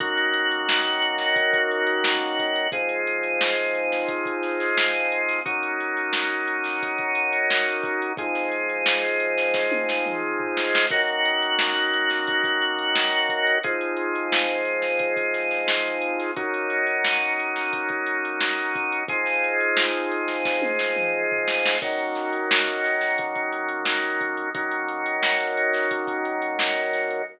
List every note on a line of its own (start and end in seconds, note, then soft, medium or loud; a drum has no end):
0.00 2.67 D#3 medium
0.00 2.67 A#3 loud
0.00 2.67 C#4 medium
0.00 2.67 F#4 medium
0.00 kick loud
0.00 closed hi-hat loud
0.17 closed hi-hat medium
0.34 closed hi-hat medium
0.51 closed hi-hat medium
0.69 snare loud
0.86 closed hi-hat medium
1.02 closed hi-hat medium
1.18 snare medium
1.18 closed hi-hat medium
1.36 kick loud
1.36 closed hi-hat medium
1.53 kick medium
1.53 closed hi-hat medium
1.71 closed hi-hat medium
1.87 closed hi-hat medium
2.04 snare loud
2.21 closed hi-hat medium
2.39 kick medium
2.39 closed hi-hat medium
2.56 closed hi-hat medium
2.72 5.40 F3 medium
2.72 5.40 G#3 medium
2.72 5.40 C4 medium
2.72 5.40 D#4 medium
2.72 kick loud
2.72 closed hi-hat loud
2.89 closed hi-hat medium
3.07 closed hi-hat medium
3.23 closed hi-hat medium
3.41 snare loud
3.58 closed hi-hat medium
3.75 closed hi-hat medium
3.92 snare medium
3.92 closed hi-hat medium
4.08 kick medium
4.08 closed hi-hat loud
4.25 kick medium
4.25 closed hi-hat medium
4.43 snare soft
4.43 closed hi-hat medium
4.60 snare soft
4.60 closed hi-hat medium
4.77 snare loud
4.94 closed hi-hat medium
5.12 closed hi-hat medium
5.29 snare soft
5.29 closed hi-hat medium
5.45 8.12 F#3 medium
5.45 8.12 A#3 medium
5.45 8.12 C#4 medium
5.45 8.12 D#4 medium
5.45 kick loud
5.45 closed hi-hat medium
5.63 closed hi-hat medium
5.80 closed hi-hat medium
5.97 closed hi-hat medium
6.13 snare loud
6.31 closed hi-hat medium
6.48 closed hi-hat medium
6.64 snare medium
6.64 closed hi-hat medium
6.83 kick medium
6.83 closed hi-hat loud
6.98 kick medium
6.98 closed hi-hat medium
7.15 closed hi-hat medium
7.33 closed hi-hat medium
7.50 snare loud
7.66 closed hi-hat medium
7.84 kick loud
7.84 closed hi-hat medium
8.02 closed hi-hat medium
8.17 10.85 F3 medium
8.17 10.85 G#3 medium
8.17 10.85 C4 medium
8.17 10.85 D#4 medium
8.17 kick loud
8.17 closed hi-hat loud
8.35 snare soft
8.35 closed hi-hat medium
8.52 closed hi-hat medium
8.70 closed hi-hat medium
8.86 snare loud
9.04 closed hi-hat medium
9.20 closed hi-hat medium
9.38 snare medium
9.38 closed hi-hat medium
9.54 kick medium
9.54 snare medium
9.72 high tom medium
9.89 snare medium
10.06 mid tom medium
10.40 floor tom medium
10.57 snare medium
10.75 snare loud
10.90 13.58 D#3 medium
10.90 13.58 A#3 loud
10.90 13.58 C#4 medium
10.90 13.58 F#4 medium
10.90 kick loud
10.90 closed hi-hat loud
11.08 closed hi-hat medium
11.25 closed hi-hat medium
11.42 closed hi-hat medium
11.59 snare loud
11.76 closed hi-hat medium
11.93 closed hi-hat medium
12.10 snare medium
12.10 closed hi-hat medium
12.27 kick loud
12.27 closed hi-hat medium
12.44 kick medium
12.44 closed hi-hat medium
12.62 closed hi-hat medium
12.79 closed hi-hat medium
12.95 snare loud
13.12 closed hi-hat medium
13.29 kick medium
13.29 closed hi-hat medium
13.47 closed hi-hat medium
13.63 16.31 F3 medium
13.63 16.31 G#3 medium
13.63 16.31 C4 medium
13.63 16.31 D#4 medium
13.63 kick loud
13.63 closed hi-hat loud
13.81 closed hi-hat medium
13.97 closed hi-hat medium
14.15 closed hi-hat medium
14.32 snare loud
14.49 closed hi-hat medium
14.65 closed hi-hat medium
14.82 snare medium
14.82 closed hi-hat medium
14.99 kick medium
14.99 closed hi-hat loud
15.17 kick medium
15.17 closed hi-hat medium
15.34 snare soft
15.34 closed hi-hat medium
15.51 snare soft
15.51 closed hi-hat medium
15.68 snare loud
15.85 closed hi-hat medium
16.02 closed hi-hat medium
16.20 snare soft
16.20 closed hi-hat medium
16.36 19.03 F#3 medium
16.36 19.03 A#3 medium
16.36 19.03 C#4 medium
16.36 19.03 D#4 medium
16.36 kick loud
16.36 closed hi-hat medium
16.54 closed hi-hat medium
16.70 closed hi-hat medium
16.87 closed hi-hat medium
17.05 snare loud
17.23 closed hi-hat medium
17.39 closed hi-hat medium
17.56 snare medium
17.56 closed hi-hat medium
17.73 kick medium
17.73 closed hi-hat loud
17.89 kick medium
17.89 closed hi-hat medium
18.06 closed hi-hat medium
18.25 closed hi-hat medium
18.41 snare loud
18.58 closed hi-hat medium
18.75 kick loud
18.75 closed hi-hat medium
18.92 closed hi-hat medium
19.08 21.76 F3 medium
19.08 21.76 G#3 medium
19.08 21.76 C4 medium
19.08 21.76 D#4 medium
19.08 kick loud
19.08 closed hi-hat loud
19.26 snare soft
19.26 closed hi-hat medium
19.44 closed hi-hat medium
19.61 closed hi-hat medium
19.77 snare loud
19.94 closed hi-hat medium
20.12 closed hi-hat medium
20.28 snare medium
20.28 closed hi-hat medium
20.45 kick medium
20.45 snare medium
20.62 high tom medium
20.79 snare medium
20.96 mid tom medium
21.32 floor tom medium
21.48 snare medium
21.65 snare loud
21.82 24.49 D#3 medium
21.82 24.49 F#3 medium
21.82 24.49 A#3 medium
21.82 24.49 C#4 medium
21.82 kick loud
21.82 crash loud
21.99 closed hi-hat medium
22.15 snare soft
22.15 closed hi-hat medium
22.33 closed hi-hat medium
22.51 snare loud
22.67 closed hi-hat medium
22.84 snare soft
22.84 closed hi-hat medium
23.01 snare medium
23.01 closed hi-hat medium
23.18 kick medium
23.18 closed hi-hat loud
23.35 kick medium
23.35 closed hi-hat medium
23.53 closed hi-hat medium
23.68 closed hi-hat medium
23.85 snare loud
24.03 closed hi-hat medium
24.21 kick medium
24.21 closed hi-hat medium
24.37 closed hi-hat medium
24.54 27.22 D#3 medium
24.54 27.22 F#3 medium
24.54 27.22 A#3 medium
24.54 27.22 C#4 medium
24.54 kick loud
24.54 closed hi-hat loud
24.71 closed hi-hat medium
24.88 closed hi-hat medium
25.06 closed hi-hat medium
25.23 snare loud
25.40 closed hi-hat medium
25.57 closed hi-hat medium
25.73 snare medium
25.73 closed hi-hat medium
25.91 kick medium
25.91 closed hi-hat loud
26.07 kick medium
26.07 closed hi-hat medium
26.25 closed hi-hat medium
26.42 closed hi-hat medium
26.59 snare loud
26.75 closed hi-hat medium
26.93 snare soft
26.93 closed hi-hat medium
27.11 closed hi-hat medium